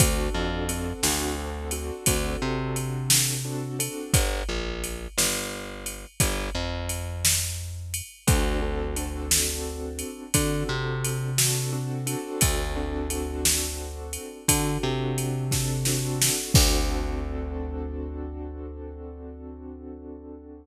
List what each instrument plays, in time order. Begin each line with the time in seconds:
0.00 electric bass (finger) D2, acoustic grand piano C4 D4 F#4 A4, kick, ride
0.34 electric bass (finger) F2
0.69 acoustic grand piano C4 D4 F#4 A4, ride
1.03 electric bass (finger) D2, acoustic grand piano C4 D4 F#4 A4, snare
1.38 acoustic grand piano C4 D4 F#4 A4
1.71 acoustic grand piano C4 D4 F#4 A4, ride
2.06 electric bass (finger) D2, acoustic grand piano C4 D4 F#4 A4, kick, ride
2.42 electric bass (finger) C3
2.76 ride
3.10 snare
3.45 acoustic grand piano C4 D4 F#4 A4
3.79 acoustic grand piano C4 D4 F#4 A4, ride
4.14 electric bass (finger) G1, kick, ride
4.49 electric bass (finger) A#1
4.84 ride
5.18 electric bass (finger) G1, snare
5.86 ride
6.20 electric bass (finger) G1, kick, ride
6.55 electric bass (finger) F2
6.89 ride
7.25 snare
7.94 ride
8.27 electric bass (finger) D2, acoustic grand piano C4 D4 F#4 A4, kick, ride
8.62 acoustic grand piano C4 D4 F#4 A4
8.96 acoustic grand piano C4 D4 F#4 A4, ride
9.31 snare
9.99 ride
10.34 electric bass (finger) D3, acoustic grand piano C4 D4 F#4 A4, kick, ride
10.69 electric bass (finger) C3
11.04 ride
11.38 acoustic grand piano C4 D4 F#4 A4, snare
11.73 acoustic grand piano C4 D4 F#4 A4
12.06 acoustic grand piano C4 D4 F#4 A4, ride
12.41 electric bass (finger) D2, kick, ride
12.76 acoustic grand piano C4 D4 F#4 A4
13.10 acoustic grand piano C4 D4 F#4 A4, ride
13.45 snare
14.13 ride
14.48 electric bass (finger) D3, acoustic grand piano C4 D4 F#4 A4, kick, ride
14.83 electric bass (finger) C3
15.18 ride
15.51 acoustic grand piano C4 D4 F#4 A4, kick, snare
15.85 acoustic grand piano C4 D4 F#4 A4, snare
16.22 snare
16.54 electric bass (finger) D2, acoustic grand piano C4 D4 F#4 A4, kick, crash